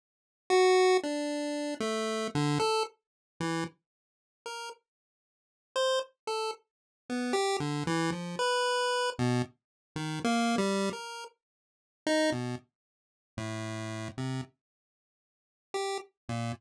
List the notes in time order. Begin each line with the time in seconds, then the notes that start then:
0.50 F#4
1.03 D4
1.80 A3
2.35 D3
2.60 A4
3.40 E3
4.46 A#4
5.76 C5
6.27 A4
7.09 B3
7.33 G4
7.60 D3
7.87 E3
8.12 F3
8.39 B4
9.19 B2
9.96 D#3
10.24 A#3
10.58 G3
10.93 A#4
12.07 D#4
12.32 B2
13.37 A2
14.18 C3
15.74 G4
16.29 A#2